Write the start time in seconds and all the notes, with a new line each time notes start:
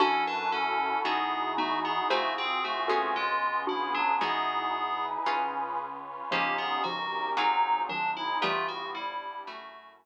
0.00 F#2 C#4 D4 E4 F#4 A4
0.27 D4 B4
0.52 C#4 A4
1.04 E2 B3 D#4 E4 F#4 G#4
1.57 A3 B3 D#4 F#4
1.85 B3 G#4
2.10 C2 A3 C4 F4 F#4 G#4 C5
2.38 C4 G#4
2.64 A3 F#4
2.88 B3 C#4 F4 F#4 G#4 A4
3.15 C#2 G#3 B3 C#4 F4 G#4
3.67 D4 E4 F#4
3.94 F#3 D4
4.21 E2 E3 G#3 B3 D#4 E4 F#4 G#4
4.74 D#4 E4 G#4 B4
5.26 C#2 C#4 F4 G#4 B4
5.79 C#4 F4 B4 C#5
6.31 G1 C#3 F3 A#3 C#4 D#4 F4 G4
6.58 B3 G#4
6.84 C#3 F3 C#4 D#4 F#4 G4 A#4
7.37 G#1 F#3 C4 D#4 F4 F#4 G#4
7.89 D#3 F#3 C4 D4 D#4 F4 G#4
8.17 E4
8.41 G1 E3 G3 A3 B3 E4 F4 G4
8.68 F#4
8.95 G3 B3 D4 E4 G4
9.47 F#2 A3 C#4 E4 F#4
10.00 A3 C#4 F#4 A4